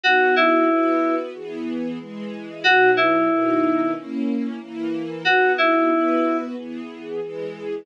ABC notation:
X:1
M:4/4
L:1/8
Q:1/4=92
K:B
V:1 name="Electric Piano 2"
F E3 z4 | F E3 z4 | F E3 z4 |]
V:2 name="String Ensemble 1"
[B,DF]2 [B,FB]2 [E,B,G]2 [E,G,G]2 | [B,,F,D]2 [B,,D,D]2 [A,CE]2 [E,A,E]2 | [B,DF]2 [B,FB]2 [E,B,G]2 [E,G,G]2 |]